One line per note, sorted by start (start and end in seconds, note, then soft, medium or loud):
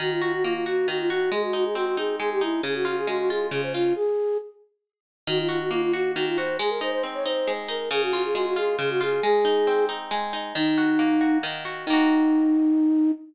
0.00 0.87 D#3 loud
0.00 0.10 F#4 medium
0.11 0.21 F4 medium
0.22 0.32 F4 medium
0.22 0.66 F#4 medium
0.33 0.44 F#4 medium
0.44 1.28 A#3 medium
0.44 0.54 F4 medium
0.54 0.65 F4 medium
0.66 1.10 F#4 medium
0.66 0.87 F#4 medium
0.88 1.30 D#3 medium
0.88 0.98 F#4 medium
0.99 1.09 F4 medium
1.10 1.31 F#4 medium
1.10 1.30 F#4 medium
1.32 2.19 G#3 medium
1.32 1.42 G#4 medium
1.43 1.53 F#4 medium
1.53 1.97 D#4 medium
1.53 1.64 F#4 medium
1.65 1.75 G#4 medium
1.75 2.59 C4 medium
1.75 1.86 F#4 medium
1.86 1.97 F#4 medium
1.97 2.41 D#4 medium
1.97 2.16 G#4 medium
2.20 2.61 G#3 medium
2.20 2.30 G#4 medium
2.32 2.42 G4 medium
2.41 2.62 D#4 medium
2.41 2.61 E4 medium
2.63 3.51 C#3 medium
2.63 2.75 G#4 medium
2.75 2.85 F#4 medium
2.85 3.30 F4 medium
2.85 2.97 F#4 medium
2.97 3.08 G#4 medium
3.07 3.91 G#3 medium
3.07 3.18 F#4 medium
3.19 3.29 F#4 medium
3.29 3.74 F4 medium
3.29 3.47 G#4 medium
3.51 3.93 C#3 medium
3.51 3.61 G#4 medium
3.63 3.73 C5 medium
3.74 3.93 F4 medium
3.74 3.95 F4 medium
3.96 4.38 G#4 medium
5.27 6.15 D#3 loud
5.27 5.38 F#4 medium
5.39 5.48 F4 medium
5.49 5.59 F4 medium
5.49 5.93 F#4 medium
5.60 5.71 F#4 medium
5.71 6.54 A#3 medium
5.71 5.82 F4 medium
5.82 5.93 F4 medium
5.93 6.37 F#4 medium
5.93 6.11 F#4 medium
6.15 6.58 D#3 medium
6.15 6.26 F#4 medium
6.27 6.37 F4 medium
6.37 6.59 F#4 medium
6.37 6.57 C5 medium
6.59 7.47 G#3 loud
6.59 6.70 G#4 medium
6.70 6.80 A#4 medium
6.81 7.25 D#4 medium
6.81 6.92 C5 medium
6.92 7.03 C5 medium
7.03 7.87 C4 medium
7.14 7.25 C#5 medium
7.25 7.68 D#4 medium
7.25 7.53 C5 medium
7.47 7.89 G#3 medium
7.68 7.89 D#4 medium
7.68 7.90 A#4 medium
7.91 8.78 C#3 loud
7.91 8.02 G#4 medium
8.02 8.13 F#4 medium
8.13 8.56 F4 medium
8.13 8.24 F#4 medium
8.24 8.35 G#4 medium
8.35 9.18 G#3 medium
8.35 8.45 F#4 medium
8.46 8.57 F#4 medium
8.56 9.00 F4 medium
8.56 8.76 G#4 medium
8.79 9.20 C#3 medium
8.79 8.90 G#4 medium
8.90 9.01 F#4 medium
9.01 9.22 F4 medium
9.01 9.23 G#4 medium
9.23 10.11 G#3 medium
9.23 9.86 G#4 loud
9.45 9.88 D#4 medium
9.67 10.51 C4 medium
9.89 10.33 D#4 medium
10.11 10.53 G#3 medium
10.33 10.54 D#4 medium
10.55 11.43 D#3 loud
10.55 11.38 D#4 medium
10.78 11.20 F#4 medium
10.99 11.83 A#3 medium
11.21 11.65 F#4 medium
11.43 11.85 D#3 loud
11.65 11.86 F#4 medium
11.86 13.12 D#3 medium
11.86 13.12 A#3 loud
11.86 13.11 D#4 loud
11.93 13.12 F#4 loud